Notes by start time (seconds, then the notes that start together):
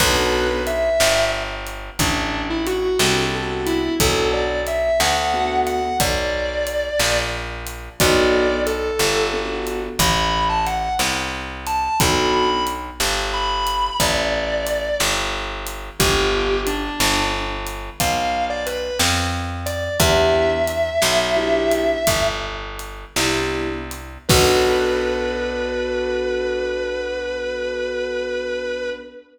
0.00 B1 B3 D4 F#4 A4 B4, kick, crash
0.67 E5, closed hi-hat
1.00 G1, snare
1.67 closed hi-hat
1.99 A1 D4, kick, closed hi-hat
2.50 E4
2.67 F#4, closed hi-hat
2.99 C2 B3 D4 F#4 A4, snare
3.33 B3 D4 F#4 A4
3.67 E4, closed hi-hat
4.00 B1 B3 D4 F#4 A4, kick, closed hi-hat
4.33 D5
4.67 E5, closed hi-hat
5.00 D2 F#5, snare
5.33 B3 D4 F#4 A4
5.67 F#5, closed hi-hat
6.00 B1 D5, kick, closed hi-hat
6.67 closed hi-hat
6.99 A#1, snare
7.67 closed hi-hat
8.00 B1 B3 D4 F#4 A4 D5, kick, closed hi-hat
8.66 A4, closed hi-hat
8.99 G1, snare
9.33 B3 D4 F#4 A4
9.67 closed hi-hat
9.99 A1 B5, kick, closed hi-hat
10.49 A5
10.67 F#5, closed hi-hat
10.99 C2, snare
11.67 A5, closed hi-hat
12.00 B1 B3 D4 F#4 A4 B5, kick, closed hi-hat
12.33 B5
12.67 closed hi-hat
13.00 G1, snare
13.34 B5
13.67 closed hi-hat
14.00 A1 D5, kick, closed hi-hat
14.67 closed hi-hat
15.00 G1, snare
15.67 closed hi-hat
16.00 G1 B3 D4 F4 G4, kick, closed hi-hat
16.67 D4, closed hi-hat
17.00 G1, snare
17.67 closed hi-hat
18.00 B1 F5, kick, closed hi-hat
18.50 D5
18.66 B4, closed hi-hat
18.99 F2, snare
19.66 D5, closed hi-hat
20.00 E2 B3 D4 E4 G4 E5, kick, closed hi-hat
20.68 closed hi-hat
21.02 B1, snare
21.36 B3 D4 E4 G4
21.71 closed hi-hat
22.07 G1, kick, closed hi-hat
22.79 closed hi-hat
23.16 C2 B3 D4 E4 G4, snare
23.91 closed hi-hat
24.29 B1 B3 D4 F#4 A4 B4, kick, crash